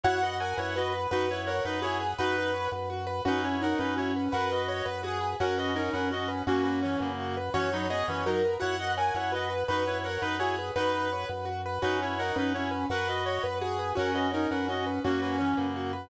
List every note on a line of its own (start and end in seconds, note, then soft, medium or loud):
0.04 0.54 F#2 medium
0.04 0.18 E4 medium
0.04 0.21 F#4 loud
0.04 0.18 C#5 medium
0.04 0.36 F#5 loud
0.22 0.39 F#4 soft
0.22 0.39 B4 medium
0.22 0.39 D#5 medium
0.40 0.57 A#4 medium
0.40 0.56 C#5 medium
0.40 0.57 F#5 medium
0.40 0.56 G#5 medium
0.57 1.07 F#2 medium
0.57 0.75 E4 medium
0.57 0.73 B4 medium
0.57 0.75 C#5 medium
0.57 0.75 F#5 medium
0.76 0.93 F#4 medium
0.76 1.08 B4 medium
0.76 0.93 D#5 medium
0.92 1.08 B4 medium
1.11 1.61 F#2 medium
1.11 1.26 D#4 medium
1.11 1.29 F#4 loud
1.11 1.40 B4 loud
1.11 1.26 B4 medium
1.29 1.46 E4 medium
1.29 1.45 B4 medium
1.29 1.46 C#5 medium
1.47 1.63 A#4 medium
1.47 1.63 C#5 medium
1.47 1.64 C#5 medium
1.47 1.63 F#5 medium
1.63 2.14 F#2 medium
1.63 1.79 D#4 medium
1.63 1.79 B4 medium
1.63 1.83 B4 medium
1.82 1.99 E4 medium
1.82 1.98 F#4 medium
1.82 2.12 G#4 loud
1.82 1.99 C#5 medium
2.01 2.17 B4 medium
2.18 2.68 F#2 medium
2.18 2.51 D#4 medium
2.18 2.36 F#4 medium
2.18 2.69 B4 loud
2.18 2.51 B4 medium
2.38 2.54 B4 medium
2.54 2.70 C#5 medium
2.72 3.21 F#2 medium
2.72 2.89 B4 medium
2.90 3.06 F#4 medium
3.07 3.23 B4 medium
3.25 3.75 F#2 medium
3.25 3.56 C#4 loud
3.25 3.44 D#4 medium
3.25 3.41 F#4 loud
3.25 3.44 B4 medium
3.43 3.61 E4 medium
3.43 3.60 B4 medium
3.43 3.61 C#5 medium
3.61 3.78 D#4 loud
3.61 3.78 A#4 medium
3.61 3.78 C#5 medium
3.61 3.78 F#5 medium
3.78 4.29 F#2 medium
3.78 3.96 C#4 medium
3.78 3.94 D#4 medium
3.78 3.94 B4 medium
3.96 4.29 C#4 medium
3.96 4.12 E4 medium
3.96 4.12 F#4 medium
3.96 4.12 C#5 medium
4.16 4.32 B4 medium
4.32 4.82 F#2 medium
4.32 4.49 F#4 loud
4.32 4.50 A#4 medium
4.32 4.63 B4 loud
4.32 4.50 F#5 medium
4.51 4.86 F#4 medium
4.51 4.69 B4 medium
4.51 4.86 D#5 medium
4.68 4.85 C#5 medium
4.85 5.35 F#2 medium
4.85 5.01 B4 medium
4.85 5.00 B4 medium
5.03 5.19 F#4 medium
5.03 5.33 G#4 loud
5.20 5.37 B4 medium
5.40 5.90 F#2 medium
5.40 5.71 C#4 loud
5.40 5.57 F#4 loud
5.40 5.55 A#4 medium
5.40 5.55 F#5 medium
5.58 5.74 F#4 medium
5.58 5.74 B4 medium
5.58 5.74 D#5 medium
5.75 5.90 C#4 medium
5.75 5.92 D#4 medium
5.75 5.90 A#4 medium
5.75 5.92 C#5 medium
5.93 6.43 F#2 medium
5.93 6.11 C#4 medium
5.93 6.08 A#4 medium
5.93 6.09 B4 medium
5.93 6.08 F#5 medium
6.11 6.42 C#4 medium
6.11 6.27 F#4 medium
6.11 6.28 F#4 medium
6.11 6.28 D#5 medium
6.28 6.44 B4 medium
6.47 6.96 F#2 loud
6.47 6.63 A#3 medium
6.47 7.09 C#4 loud
6.47 6.63 F#4 medium
6.47 6.65 F#4 medium
6.63 6.80 A#3 medium
6.63 6.80 F#4 medium
6.63 6.79 B4 medium
6.83 7.00 E3 medium
6.83 7.00 C#4 medium
6.83 6.99 C#5 medium
6.99 7.50 F#2 medium
6.99 7.35 C#3 medium
6.99 7.35 A#3 medium
6.99 7.15 B4 medium
7.19 7.36 F#4 medium
7.37 7.53 B4 medium
7.54 8.03 F#2 medium
7.54 7.69 E3 medium
7.54 7.69 C#4 medium
7.54 7.70 F#4 loud
7.54 7.86 C#5 loud
7.72 7.87 F#3 medium
7.72 7.87 D#4 medium
7.72 7.90 B4 medium
7.90 8.07 B3 medium
7.90 8.07 G#4 medium
7.90 8.06 C#5 medium
7.90 8.06 D#5 loud
8.08 8.57 F#2 medium
8.08 8.23 E3 medium
8.08 8.23 C#4 medium
8.08 8.25 B4 medium
8.08 8.24 C#5 medium
8.26 8.42 F#3 medium
8.26 8.42 D#4 medium
8.26 8.42 F#4 medium
8.26 8.55 A#4 loud
8.45 8.61 B4 medium
8.60 9.11 F#2 medium
8.60 8.76 E4 medium
8.60 8.76 F#4 loud
8.60 8.76 C#5 medium
8.60 8.92 F#5 loud
8.79 8.96 F#4 soft
8.79 8.95 B4 medium
8.79 8.96 D#5 medium
8.97 9.14 A#4 medium
8.97 9.13 C#5 medium
8.97 9.14 F#5 medium
8.97 9.13 G#5 medium
9.14 9.64 F#2 medium
9.14 9.32 E4 medium
9.14 9.31 B4 medium
9.14 9.32 C#5 medium
9.14 9.32 F#5 medium
9.32 9.48 F#4 medium
9.32 9.50 F#4 medium
9.32 9.65 B4 medium
9.32 9.50 D#5 medium
9.50 9.66 B4 medium
9.68 10.18 F#2 medium
9.68 9.83 D#4 medium
9.68 9.84 F#4 loud
9.68 9.98 B4 loud
9.68 9.83 B4 medium
9.86 10.03 E4 medium
9.86 10.02 B4 medium
9.86 10.03 C#5 medium
10.04 10.21 A#4 medium
10.04 10.21 C#5 medium
10.04 10.21 F#5 medium
10.22 10.71 F#2 medium
10.22 10.36 D#4 medium
10.22 10.36 B4 medium
10.22 10.38 B4 medium
10.22 10.40 B4 medium
10.39 10.55 E4 medium
10.39 10.56 F#4 medium
10.39 10.69 G#4 loud
10.39 10.55 C#5 medium
10.59 10.75 B4 medium
10.76 11.25 F#2 medium
10.76 11.08 D#4 medium
10.76 10.92 F#4 medium
10.76 11.27 B4 loud
10.76 11.08 B4 medium
10.94 11.10 B4 medium
11.13 11.29 C#5 medium
11.29 11.79 F#2 medium
11.29 11.45 B4 medium
11.45 11.61 F#4 medium
11.66 11.82 B4 medium
11.82 12.32 F#2 medium
11.82 12.13 C#4 loud
11.82 12.00 D#4 medium
11.82 11.98 F#4 loud
11.82 12.00 B4 medium
12.02 12.19 E4 medium
12.02 12.18 B4 medium
12.02 12.19 C#5 medium
12.19 12.36 D#4 loud
12.19 12.35 A#4 medium
12.19 12.35 C#5 medium
12.19 12.35 F#5 medium
12.36 12.85 F#2 medium
12.36 12.53 C#4 medium
12.36 12.52 D#4 medium
12.36 12.52 B4 medium
12.54 12.85 C#4 medium
12.54 12.69 E4 medium
12.54 12.70 F#4 medium
12.54 12.69 C#5 medium
12.71 12.87 B4 medium
12.90 13.39 F#2 medium
12.90 13.07 F#4 loud
12.90 13.08 A#4 medium
12.90 13.22 B4 loud
12.90 13.08 F#5 medium
13.07 13.43 F#4 medium
13.07 13.24 B4 medium
13.07 13.43 D#5 medium
13.26 13.43 C#5 medium
13.26 13.42 C#5 medium
13.43 13.93 F#2 medium
13.43 13.59 B4 medium
13.43 13.58 B4 medium
13.61 13.77 F#4 medium
13.61 13.90 G#4 loud
13.79 13.95 B4 medium
13.95 14.47 F#2 medium
13.95 14.28 C#4 loud
13.95 14.11 F#4 loud
13.95 14.13 A#4 medium
13.95 14.13 F#5 medium
14.14 14.30 F#4 medium
14.14 14.31 B4 medium
14.14 14.30 D#5 medium
14.31 14.48 C#4 medium
14.31 14.51 D#4 medium
14.31 14.48 A#4 medium
14.31 14.47 C#5 medium
14.51 15.00 F#2 medium
14.51 14.68 C#4 medium
14.51 14.65 A#4 medium
14.51 14.67 B4 medium
14.51 14.65 F#5 medium
14.68 14.99 C#4 medium
14.68 14.84 F#4 medium
14.68 14.85 F#4 medium
14.68 14.85 D#5 medium
14.86 15.02 B4 medium
15.04 15.54 F#2 loud
15.04 15.20 A#3 medium
15.04 15.66 C#4 loud
15.04 15.21 F#4 medium
15.04 15.20 F#4 medium
15.21 15.36 A#3 medium
15.21 15.36 F#4 medium
15.21 15.38 B4 medium
15.38 15.56 E3 medium
15.38 15.56 C#4 medium
15.38 15.54 C#5 medium
15.57 16.07 F#2 medium
15.57 15.91 C#3 medium
15.57 15.91 A#3 medium
15.57 15.73 B4 medium
15.76 15.92 F#4 medium
15.93 16.09 B4 medium